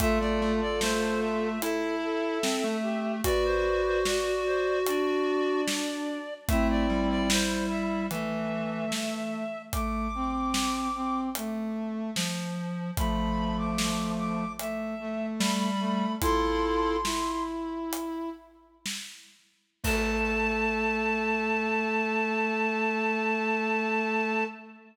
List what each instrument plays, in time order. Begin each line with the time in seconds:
0.00 lead 1 (square) A3, brass section F4 A4, clarinet E5, kick, closed hi-hat
0.20 lead 1 (square) A3, clarinet D5
0.42 lead 1 (square) A3
0.61 clarinet D5
0.81 lead 1 (square) A3, clarinet C5, snare
1.22 clarinet E5
1.62 lead 1 (square) E4, brass section A4, clarinet E5, closed hi-hat
2.03 brass section A4
2.43 lead 1 (square) C4, snare
2.64 lead 1 (square) A3
2.83 brass section G4
3.24 lead 1 (square) F#4, brass section B4 D5, clarinet D5, kick, closed hi-hat
3.45 clarinet C5
3.85 clarinet C5
4.05 clarinet F#4, brass section D5, snare
4.46 clarinet C5
4.86 brass section D4, clarinet D5, closed hi-hat
5.68 snare
6.48 lead 1 (square) A3, brass section C4 E4, clarinet E5, kick, closed hi-hat
6.70 clarinet D5
6.89 lead 1 (square) G3
7.10 clarinet D5
7.30 brass section E4, clarinet C5, snare
7.70 clarinet E5
8.11 lead 1 (square) E3, brass section A3, clarinet E5, closed hi-hat
8.92 snare
9.72 brass section A3, clarinet D6, kick, closed hi-hat
10.15 brass section C4
10.54 snare
10.95 brass section C4
11.35 brass section A3, closed hi-hat
12.16 lead 1 (square) F3, snare
12.97 brass section F3 A3, clarinet B5, kick, closed hi-hat
13.58 clarinet D6
13.78 snare
14.18 clarinet D6
14.59 brass section A3, clarinet E5, closed hi-hat
15.00 brass section A3
15.40 lead 1 (square) G3, clarinet B5, snare
15.80 brass section A3
16.22 lead 1 (square) E4, brass section F4 A4, clarinet C6, kick, closed hi-hat
17.05 brass section E4, snare
17.93 closed hi-hat
18.86 snare
19.84 lead 1 (square) A3, brass section A4, clarinet A5, kick, crash